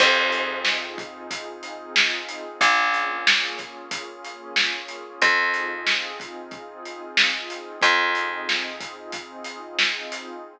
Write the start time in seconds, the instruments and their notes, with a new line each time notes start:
0.00 electric bass (finger) F2, pad 2 (warm) C4 D#4 F4 G#4, kick, crash
0.32 closed hi-hat
0.65 snare
0.98 kick, closed hi-hat
1.31 kick, closed hi-hat
1.63 closed hi-hat
1.96 snare
2.29 closed hi-hat
2.60 electric bass (finger) A#1, pad 2 (warm) A#3 C#4 F4 G#4, kick, closed hi-hat
2.94 closed hi-hat
3.27 snare
3.58 kick, snare, closed hi-hat
3.91 kick, closed hi-hat
4.24 closed hi-hat
4.56 snare
4.88 closed hi-hat
5.20 electric bass (finger) F2, pad 2 (warm) C4 D#4 F4 G#4, kick, closed hi-hat
5.54 closed hi-hat
5.87 snare
6.20 kick, closed hi-hat
6.51 kick, closed hi-hat
6.85 closed hi-hat
7.17 snare
7.50 closed hi-hat
7.82 electric bass (finger) F2, pad 2 (warm) C4 D#4 F4 G#4, kick, closed hi-hat
8.15 closed hi-hat
8.49 snare
8.80 kick, closed hi-hat
9.12 kick, closed hi-hat
9.44 closed hi-hat
9.79 snare
10.12 closed hi-hat